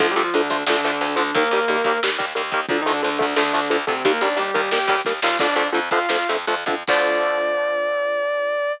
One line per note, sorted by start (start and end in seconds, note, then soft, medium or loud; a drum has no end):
0.00 0.14 D2 loud
0.00 0.07 D3 loud
0.00 0.07 F3 medium
0.00 0.10 F3 medium
0.00 0.07 A3 medium
0.00 0.10 F4 medium
0.00 kick loud
0.00 closed hi-hat loud
0.11 0.21 G3 medium
0.11 0.21 G4 medium
0.16 0.30 D2 medium
0.16 0.23 D3 medium
0.16 0.23 F3 medium
0.16 0.23 A3 medium
0.16 closed hi-hat medium
0.23 0.33 F3 medium
0.23 0.33 F4 medium
0.33 0.48 D2 medium
0.33 0.63 D3 medium
0.33 0.42 D3 medium
0.33 0.42 F3 medium
0.33 0.42 A3 medium
0.33 0.63 D4 medium
0.33 closed hi-hat loud
0.50 0.64 D2 medium
0.50 0.57 D3 medium
0.50 0.57 F3 medium
0.50 0.57 A3 medium
0.50 kick medium
0.50 closed hi-hat medium
0.67 0.81 D2 loud
0.67 1.16 D3 medium
0.67 0.76 D3 medium
0.67 0.76 F3 medium
0.67 0.76 A3 medium
0.67 1.16 D4 medium
0.67 snare loud
0.83 0.99 D2 medium
0.83 0.91 D3 medium
0.83 0.91 F3 medium
0.83 0.91 A3 medium
0.83 snare medium
0.83 closed hi-hat medium
1.01 1.15 D2 medium
1.01 1.08 D3 medium
1.01 1.08 F3 medium
1.01 1.08 A3 medium
1.01 closed hi-hat loud
1.16 1.31 D2 medium
1.16 1.23 D3 medium
1.16 1.33 D3 medium
1.16 1.23 F3 medium
1.16 1.23 A3 medium
1.16 1.33 D4 medium
1.16 closed hi-hat medium
1.34 1.49 D#2 loud
1.34 1.43 D#3 medium
1.34 1.43 G3 medium
1.34 2.00 A#3 medium
1.34 1.43 A#3 loud
1.34 2.00 A#4 medium
1.34 kick loud
1.34 closed hi-hat loud
1.51 1.65 D#2 medium
1.51 1.60 D#3 medium
1.51 1.60 G3 medium
1.51 1.60 A#3 medium
1.51 closed hi-hat medium
1.68 1.82 D#2 loud
1.68 1.76 D#3 medium
1.68 1.76 G3 medium
1.68 1.76 A#3 medium
1.68 closed hi-hat loud
1.84 1.99 D#2 medium
1.84 1.92 D#3 medium
1.84 1.92 G3 medium
1.84 1.92 A#3 medium
1.84 kick medium
1.84 closed hi-hat loud
2.03 2.18 D#2 medium
2.03 2.10 D#3 medium
2.03 2.10 G3 medium
2.03 2.10 A#3 medium
2.03 snare loud
2.18 2.34 D#2 medium
2.18 2.25 D#3 medium
2.18 2.25 G3 medium
2.18 2.25 A#3 medium
2.18 kick medium
2.18 snare medium
2.18 closed hi-hat medium
2.35 2.51 D#2 medium
2.35 2.42 D#3 medium
2.35 2.42 G3 medium
2.35 2.42 A#3 medium
2.35 closed hi-hat loud
2.52 2.66 D#2 medium
2.52 2.60 D#3 medium
2.52 2.60 G3 medium
2.52 2.60 A#3 medium
2.52 kick loud
2.52 closed hi-hat medium
2.69 2.83 D2 medium
2.69 2.80 D3 medium
2.69 2.77 D3 loud
2.69 2.77 F3 loud
2.69 2.77 A3 medium
2.69 2.80 D4 medium
2.69 kick loud
2.69 closed hi-hat loud
2.81 2.91 D#3 medium
2.81 2.91 D#4 medium
2.86 3.01 D2 medium
2.86 2.93 D3 medium
2.86 2.93 F3 medium
2.86 2.93 A3 medium
2.86 closed hi-hat medium
2.92 3.03 D3 medium
2.92 3.03 D4 medium
3.03 3.19 D2 medium
3.03 3.09 D3 medium
3.03 3.34 D3 medium
3.03 3.09 F3 medium
3.03 3.09 A3 medium
3.03 3.34 D4 medium
3.03 closed hi-hat loud
3.19 3.36 D2 medium
3.19 3.26 D3 medium
3.19 3.26 F3 medium
3.19 3.26 A3 medium
3.19 kick loud
3.19 closed hi-hat medium
3.36 3.52 D2 loud
3.36 3.43 D3 medium
3.36 3.78 D3 medium
3.36 3.43 F3 medium
3.36 3.43 A3 medium
3.36 3.78 D4 medium
3.36 snare loud
3.53 3.69 D2 medium
3.53 3.60 D3 medium
3.53 3.60 F3 medium
3.53 3.60 A3 medium
3.53 snare medium
3.53 closed hi-hat medium
3.70 3.85 D2 medium
3.70 3.77 D3 medium
3.70 3.77 F3 medium
3.70 3.77 A3 medium
3.70 closed hi-hat loud
3.87 4.02 D2 medium
3.87 4.04 C3 medium
3.87 3.94 D3 medium
3.87 3.94 F3 medium
3.87 3.94 A3 medium
3.87 4.04 C4 medium
3.87 kick loud
3.87 closed hi-hat medium
4.04 4.19 D#2 loud
4.04 4.12 D#3 medium
4.04 4.12 G3 loud
4.04 4.21 A#3 medium
4.04 4.12 A#3 loud
4.04 4.21 A#4 medium
4.04 kick loud
4.04 closed hi-hat loud
4.21 4.35 D#2 medium
4.21 4.29 D#3 medium
4.21 4.29 G3 medium
4.21 4.29 A#3 medium
4.21 4.37 D4 medium
4.21 4.37 D5 medium
4.21 closed hi-hat medium
4.36 4.51 D#2 medium
4.36 4.43 D#3 medium
4.36 4.43 G3 medium
4.36 4.71 G3 medium
4.36 4.43 A#3 medium
4.36 4.71 G4 medium
4.36 closed hi-hat loud
4.54 4.70 D#2 medium
4.54 4.61 D#3 medium
4.54 4.61 G3 medium
4.54 4.61 A#3 medium
4.54 kick medium
4.54 closed hi-hat medium
4.71 4.87 D#2 medium
4.71 4.79 D#3 medium
4.71 4.79 G3 medium
4.71 4.79 A#3 medium
4.71 5.00 G4 medium
4.71 5.00 G5 medium
4.71 snare loud
4.88 5.02 D#2 loud
4.88 4.96 D#3 medium
4.88 4.96 G3 loud
4.88 4.96 A#3 medium
4.88 kick loud
4.88 snare medium
4.88 closed hi-hat medium
5.05 5.20 D#2 medium
5.05 5.13 D#3 medium
5.05 5.13 G3 medium
5.05 5.13 A#3 medium
5.05 kick medium
5.05 snare medium
5.22 5.38 D#2 medium
5.22 5.30 D#3 medium
5.22 5.30 G3 medium
5.22 5.30 A#3 medium
5.22 5.37 F4 medium
5.22 5.37 F5 medium
5.22 snare loud
5.39 5.55 F2 loud
5.39 5.47 D3 loud
5.39 5.47 F3 medium
5.39 5.47 A3 loud
5.39 5.67 D4 medium
5.39 5.67 D5 medium
5.39 kick loud
5.39 crash loud
5.56 5.71 F2 medium
5.56 5.63 D3 medium
5.56 5.63 F3 medium
5.56 5.63 A3 medium
5.56 closed hi-hat medium
5.72 5.90 F2 medium
5.72 5.80 D3 medium
5.72 5.80 F3 medium
5.72 5.80 A3 medium
5.72 closed hi-hat loud
5.91 6.07 F2 medium
5.91 5.99 D3 medium
5.91 5.99 F3 medium
5.91 5.99 A3 medium
5.91 6.27 F4 medium
5.91 6.27 F5 medium
5.91 kick loud
5.91 closed hi-hat medium
6.09 6.25 F2 medium
6.09 6.17 D3 medium
6.09 6.17 F3 medium
6.09 6.17 A3 medium
6.09 snare loud
6.29 6.46 F2 medium
6.29 6.37 D3 medium
6.29 6.37 F3 medium
6.29 6.37 A3 medium
6.29 snare medium
6.29 closed hi-hat medium
6.47 6.64 F2 loud
6.47 6.55 D3 medium
6.47 6.55 F3 medium
6.47 6.55 A3 medium
6.47 closed hi-hat loud
6.66 6.83 F2 medium
6.66 6.75 D3 medium
6.66 6.75 F3 medium
6.66 6.75 A3 medium
6.66 kick loud
6.66 closed hi-hat medium
6.87 8.71 D2 loud
6.87 8.71 D3 medium
6.87 8.71 F3 loud
6.87 8.71 A3 medium
6.87 8.72 D5 loud
6.87 kick loud
6.87 crash loud